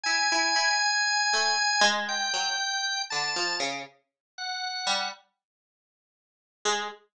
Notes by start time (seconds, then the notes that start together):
0.04 E4 G#5
0.32 E4
0.56 E4
1.33 A3
1.81 G#3
2.08 G5
2.33 F#3
3.10 D3 A5
3.36 F3
3.60 C#3
4.38 F#5
4.86 G3
6.65 G#3